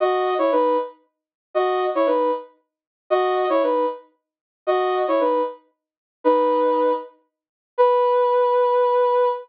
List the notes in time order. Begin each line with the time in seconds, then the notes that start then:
0.00 F#4 D#5
0.38 E4 C#5
0.52 D#4 B4
1.54 F#4 D#5
1.95 E4 C#5
2.06 D#4 B4
3.10 F#4 D#5
3.49 E4 C#5
3.63 D#4 B4
4.67 F#4 D#5
5.08 E4 C#5
5.20 D#4 B4
6.24 D#4 B4
7.78 B4